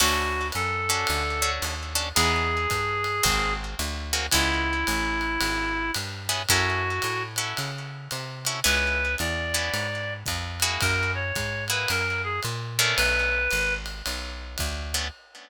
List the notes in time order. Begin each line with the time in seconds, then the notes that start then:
0.00 D2 C#4 D4 F#4 A4, crash, ride
0.52 F#2 A4, hi-hat pedal, ride
0.89 C#4 D4 F#4 A4, ride
1.07 D2, ride
1.42 C#4 D4 F#4 A4
1.62 D#2, hi-hat pedal, ride
1.95 C#4 D4 F#4 A4, ride
2.15 E2 B3 D#4 E4 G#4, ride
2.70 G2, kick, hi-hat pedal, ride
3.04 ride
3.23 G#1 A#3 C4 F#4 G#4, kick, ride
3.79 D2, hi-hat pedal, ride
4.13 A#3 C4 F#4 G#4, ride
4.31 C#2 B3 C#4 E4 G#4, kick, ride
4.87 A1, hi-hat pedal, ride
5.21 ride
5.41 G#1, ride
5.94 G2, hi-hat pedal, ride
6.29 B3 C#4 E4 G#4, ride
6.49 F#2 C#4 E4 F#4 A4, kick, ride
7.02 A2, hi-hat pedal, ride
7.36 C#4 E4 F#4 A4, ride
7.57 C#3, ride
8.11 C3, hi-hat pedal, ride
8.45 C#4 E4 F#4 A4, ride
8.64 C#2 B3 C#4 E4 G#4 B4, ride
9.18 E2 D5, hi-hat pedal, ride
9.54 B3 C#4 E4 G#4, ride
9.74 G#2, ride
10.26 F2, kick, hi-hat pedal, ride
10.60 A#3 E4 F#4 G#4, ride
10.81 F#2 A#4, kick, ride
11.15 C#5
11.35 G#2, kick, hi-hat pedal, ride
11.68 A#3 E4 F#4 G#4 B4, ride
11.88 F#2 A#4, ride
12.24 G#4
12.43 A#2, hi-hat pedal, ride
12.78 A3 B3 C#4 D4 A#4, ride
12.97 B1 B4, ride
13.51 G#1, hi-hat pedal, ride
13.86 ride
14.06 B1, ride
14.58 D2, kick, hi-hat pedal, ride
14.94 A3 B3 C#4 D4, ride